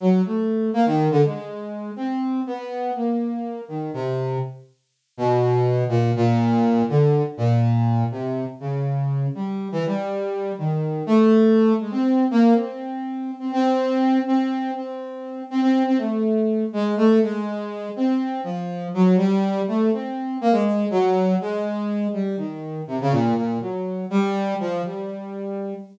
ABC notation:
X:1
M:5/8
L:1/16
Q:1/4=122
K:none
V:1 name="Brass Section"
_G,2 A,4 _B, _E,2 D, | _A,6 C4 | B,4 _B,6 | _E,2 C,4 z4 |
z2 B,,6 _B,,2 | _B,,6 D,3 z | _B,,6 C,3 z | _D,6 G,3 E, |
G,6 _E,4 | A,6 _A, C3 | _B,2 C7 C | C6 C4 |
C6 C C2 C | A,6 _A,2 =A,2 | _A,6 C4 | F,4 _G,2 =G,4 |
A,2 C4 _B, _A,3 | _G,4 _A,6 | G,2 _E,4 C, _D, _B,,2 | _B,,2 _G,4 =G,4 |
F,2 G,8 |]